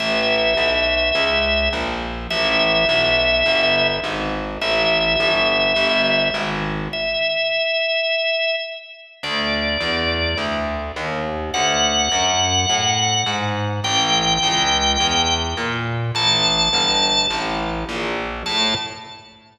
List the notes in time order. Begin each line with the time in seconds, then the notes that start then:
0.00 A1 E5
0.57 B1
1.15 C#2
1.73 A#1
2.30 A1 E5
2.89 B1
3.46 G1
4.04 G#1
4.61 A1 E5
5.20 G1
5.76 G1
6.34 G#1
6.93 E5
9.23 D2 D5
9.81 E2
10.37 D2
10.96 D#2
11.54 D2 F#5
12.12 F#2
12.69 A2
13.26 G#2
13.84 A1 G5
14.43 C#2
15.00 E2
15.57 A#2
16.15 A1 A5
16.73 G1
17.30 A1
17.89 A#1
18.46 A2 A5